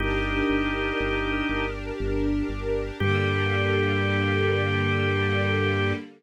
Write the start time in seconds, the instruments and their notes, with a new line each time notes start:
0.00 synth bass 1 G1, string ensemble 1 D4 G4 A#4, drawbar organ D#4 G4
0.50 synth bass 1 G1
1.00 synth bass 1 G1
1.49 synth bass 1 G1
2.00 synth bass 1 G1
2.49 synth bass 1 G1
3.00 synth bass 1 G2, string ensemble 1 D3 G3 A#3, drawbar organ G4